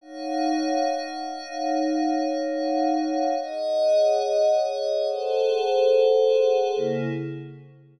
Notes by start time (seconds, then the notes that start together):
0.01 D#4 C#5 F5 F#5
3.40 G#4 C#5 D#5 F#5
5.07 G#4 A4 C5 F#5
6.76 C#3 A#3 E4 G#4